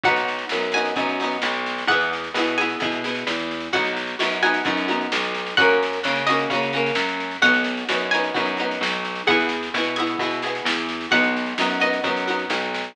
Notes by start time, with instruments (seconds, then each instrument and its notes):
0.03 electric bass (finger) B1, pizzicato strings D#4 F#4 F#5, kick, snare
0.07 pizzicato strings B3
0.16 snare
0.28 snare
0.38 snare
0.49 electric bass (finger) F#2, pizzicato strings D#4 F#4, snare
0.55 pizzicato strings B3
0.62 snare
0.72 pizzicato strings F#4 G#5, snare
0.76 pizzicato strings B3 D#4
0.85 snare
0.96 electric bass (finger) F#2, pizzicato strings B3 D#4 F#4, kick, snare
1.09 snare
1.20 pizzicato strings D#4 F#4, snare
1.24 pizzicato strings B3
1.31 snare
1.42 electric bass (finger) B1, snare
1.53 snare
1.66 snare
1.78 snare
1.87 electric bass (finger) E2, pizzicato strings E4 G#4 F#5, kick, snare
1.92 pizzicato strings B3
2.01 snare
2.13 snare
2.24 snare
2.34 electric bass (finger) B2, pizzicato strings E4 G#4, snare
2.38 pizzicato strings B3
2.47 snare
2.58 pizzicato strings B3 E4 G#4 G#5, snare
2.69 snare
2.80 electric bass (finger) B2, pizzicato strings B3 E4 G#4, kick, snare
2.92 snare
3.04 pizzicato strings B3 E4 G#4, snare
3.15 snare
3.27 electric bass (finger) E2, snare
3.39 snare
3.51 snare
3.60 snare
3.73 electric bass (finger) B1, pizzicato strings B3 D#4 F#4 F#5, kick, snare
3.84 snare
3.96 snare
4.07 snare
4.19 electric bass (finger) F#2, pizzicato strings B3 D#4 F#4, snare
4.32 snare
4.42 pizzicato strings B3 D#4 F#4 G#5, snare
4.54 snare
4.65 electric bass (finger) F#2, pizzicato strings B3 D#4 F#4, kick, snare
4.77 snare
4.88 pizzicato strings B3 D#4 F#4, snare
5.01 snare
5.12 electric bass (finger) B1, snare
5.24 snare
5.35 snare
5.46 snare
5.57 electric bass (finger) F#2, pizzicato strings A#3 C#4 F#4 F#5, kick, snare
5.70 snare
5.83 snare
5.93 snare
6.03 electric bass (finger) C#3, pizzicato strings A#3 C#4 F#4, snare
6.16 snare
6.27 pizzicato strings C#4 F#4 D#5, snare
6.32 pizzicato strings A#3
6.39 snare
6.50 electric bass (finger) C#3, pizzicato strings C#4 F#4, kick, snare
6.54 pizzicato strings A#3
6.63 snare
6.73 pizzicato strings A#3 C#4 F#4, snare
6.86 snare
6.95 electric bass (finger) F#2, snare
7.08 snare
7.20 snare
7.31 snare
7.42 electric bass (finger) B1, pizzicato strings B3 D#4 F#4 F#5, kick, snare
7.54 snare
7.64 snare
7.77 snare
7.89 electric bass (finger) F#2, pizzicato strings B3 D#4 F#4, snare
8.00 snare
8.11 pizzicato strings D#4 F#4 G#5, snare
8.15 pizzicato strings B3
8.24 snare
8.34 electric bass (finger) F#2, pizzicato strings B3 D#4 F#4, kick, snare
8.45 snare
8.57 pizzicato strings D#4 F#4, snare
8.61 pizzicato strings B3
8.71 snare
8.81 electric bass (finger) B1, snare
8.92 snare
9.05 snare
9.15 snare
9.27 electric bass (finger) E2, pizzicato strings B3 E4 G#4 F#5, kick, snare
9.40 snare
9.49 snare
9.63 snare
9.74 electric bass (finger) B2, pizzicato strings B3 E4 G#4, snare
9.84 snare
9.96 pizzicato strings B3 E4 G#4 G#5, snare
10.07 snare
10.19 electric bass (finger) B2, pizzicato strings E4 G#4, kick, snare
10.23 pizzicato strings B3
10.31 snare
10.42 pizzicato strings E4 G#4, snare
10.46 pizzicato strings B3
10.55 snare
10.65 electric bass (finger) E2, snare
10.78 snare
10.89 snare
11.01 snare
11.11 electric bass (finger) B1, pizzicato strings B3 D#4 F#4 F#5, kick, snare
11.23 snare
11.37 snare
11.46 snare
11.58 electric bass (finger) F#2, pizzicato strings B3 D#4 F#4, snare
11.70 snare
11.80 pizzicato strings B3 D#4 F#4 D#5, snare
11.93 snare
12.04 electric bass (finger) F#2, pizzicato strings B3 D#4 F#4, kick, snare
12.17 snare
12.27 pizzicato strings B3 D#4 F#4, snare
12.39 snare
12.50 electric bass (finger) B1, snare
12.62 snare
12.74 snare
12.84 snare